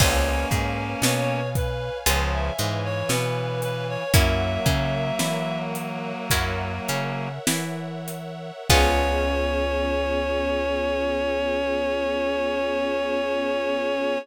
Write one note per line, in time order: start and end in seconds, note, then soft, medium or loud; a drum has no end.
0.00 0.45 C#2 loud
0.00 1.41 A#3 medium
0.00 0.46 B3 medium
0.00 0.46 C#4 medium
0.00 1.41 C#4 loud
0.00 0.46 F4 medium
0.00 0.46 G#4 medium
0.00 2.05 B4 medium
0.00 0.46 C#5 medium
0.00 2.05 C#5 medium
0.00 2.05 F5 medium
0.00 2.05 G#5 medium
0.00 kick loud
0.00 crash loud
0.51 0.95 G#2 medium
0.51 0.95 G#3 medium
0.51 kick medium
0.51 closed hi-hat medium
1.02 1.90 B2 medium
1.02 1.92 B3 medium
1.02 1.49 C#5 medium
1.02 snare loud
1.55 1.98 B4 medium
1.55 kick loud
1.55 closed hi-hat medium
2.06 2.50 C#2 loud
2.06 2.51 C#3 medium
2.06 2.51 F3 medium
2.06 2.53 B3 medium
2.06 2.53 C#4 medium
2.06 2.53 F4 medium
2.06 2.53 G#4 medium
2.06 4.13 B4 medium
2.06 2.31 C#5 medium
2.06 4.13 C#5 medium
2.06 4.13 F5 medium
2.06 4.13 G#5 medium
2.06 closed hi-hat loud
2.33 2.80 E5 medium
2.59 3.03 G#2 medium
2.59 4.03 E3 medium
2.59 3.03 G#3 medium
2.59 closed hi-hat medium
2.85 3.09 C#5 medium
3.09 3.97 B2 medium
3.09 3.98 B3 medium
3.09 3.60 B4 medium
3.09 snare loud
3.62 3.87 B4 medium
3.62 closed hi-hat medium
3.89 4.14 C#5 medium
4.14 4.58 F#2 medium
4.14 7.28 F#3 medium
4.14 4.61 A#3 medium
4.14 7.28 A#3 medium
4.14 4.61 C#4 medium
4.14 4.61 E4 medium
4.14 4.61 F#4 medium
4.14 6.30 A#4 medium
4.14 6.30 C#5 medium
4.14 5.59 E5 medium
4.14 6.30 E5 medium
4.14 6.30 F#5 medium
4.14 kick loud
4.14 closed hi-hat loud
4.66 5.11 C#3 medium
4.66 5.11 C#4 medium
4.66 kick loud
4.66 closed hi-hat medium
5.19 6.14 E3 medium
5.19 6.13 E4 medium
5.19 snare loud
5.75 closed hi-hat medium
6.30 6.80 F#2 medium
6.30 6.83 A#3 medium
6.30 6.83 C#4 medium
6.30 6.83 E4 medium
6.30 6.83 F#4 medium
6.30 8.68 A#4 medium
6.30 8.68 C#5 medium
6.30 8.68 E5 medium
6.30 8.68 F#5 medium
6.30 kick medium
6.30 closed hi-hat loud
6.88 7.39 C#3 medium
6.88 7.39 C#4 medium
6.88 closed hi-hat medium
7.47 8.51 E3 medium
7.47 8.51 E4 medium
7.47 snare loud
8.08 closed hi-hat medium
8.69 14.18 C#2 loud
8.69 14.18 B3 medium
8.69 14.19 B3 loud
8.69 14.18 C#4 loud
8.69 14.19 C#4 loud
8.69 14.18 F4 medium
8.69 14.19 F4 loud
8.69 14.18 G#4 loud
8.69 14.19 G#4 loud
8.69 14.18 C#5 loud
8.69 kick loud
8.69 crash loud